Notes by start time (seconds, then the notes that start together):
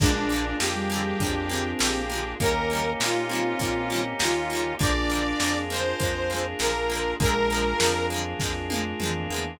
0.00 A#1 F3 G#3 A#3 D4 F4 G#4, kick, crash
0.06 D3
0.29 G#3 A#3, closed hi-hat
0.34 D3 F3
0.60 F2 F3 G#3 A#3 G4, snare
0.66 D3
0.75 G3
0.90 G#3 A#3, closed hi-hat
0.94 D3 F3
1.20 F2 G#3 A#3 D4, kick, closed hi-hat
1.25 D3 F3
1.49 F3 G#3 A#3 C4, closed hi-hat
1.55 D3
1.79 A#1 F3 G#3 A#3 G4, snare
1.84 D3
2.10 F3 G#3 A#3, closed hi-hat
2.15 D3
2.40 D#2 D#3 G3 A#3 C#4 D#4 G4 A#4, kick, closed hi-hat
2.46 C#3
2.70 G3 A#3, closed hi-hat
2.75 C#3 D#3
3.00 A#2 D#3 G3 A#3 F4, snare
3.06 C#3
3.29 D#3 G3 A#3 C4, closed hi-hat
3.35 C#3
3.59 A#2 D#3 G3 A#3, kick, closed hi-hat
3.65 C#3
3.90 G3 A#3, closed hi-hat
3.94 C#3 D#3
4.19 D#2 D#3 G3 A#3 F4, snare
4.25 C#3
4.50 G3 A#3, closed hi-hat
4.55 C#3 D#3
4.79 A#1 F3 G#3 A#3 D4 F4 G#4 D5, kick, closed hi-hat
4.85 D3
5.09 F3 G#3 A#3, closed hi-hat
5.15 D3
5.40 F2 G#3 A#3, snare
5.44 D3 F3
5.70 F3 G#3 A#3 C5, closed hi-hat
5.76 D3
6.00 F2 F3 G#3 A#3, kick, closed hi-hat
6.05 D3
6.30 G#3 A#3, closed hi-hat
6.34 D3 F3
6.59 A#1 F3 G#3 A#3 A#4, snare
6.65 D3
6.90 F3 G#3 A#3, closed hi-hat
6.95 D3
7.20 A#1 F3 G#3 A#3 D4 F4 G#4 A#4, kick, closed hi-hat
7.26 D3
7.50 G#3 A#3, closed hi-hat
7.54 D3 F3
7.80 F2 F3 G#3 A#3, snare
7.84 D3 F3
8.10 F3 G#3 A#3, closed hi-hat
8.16 D3
8.39 F2 F3 G#3 A#3, kick, snare
8.45 D3
8.70 F3 G#3 A#3, high tom
8.76 D3
9.00 F2 F3 G#3 A#3, mid tom
9.05 D3
9.30 E2 G#3 A#3
9.34 D3 F3